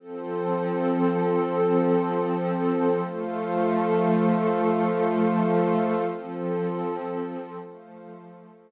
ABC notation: X:1
M:4/4
L:1/8
Q:1/4=79
K:Flyd
V:1 name="Pad 5 (bowed)"
[F,CA]8 | [F,A,A]8 | [F,CA]4 [F,A,A]4 |]
V:2 name="Pad 2 (warm)"
[FAc]8 | [Fcf]8 | [FAc]4 [Fcf]4 |]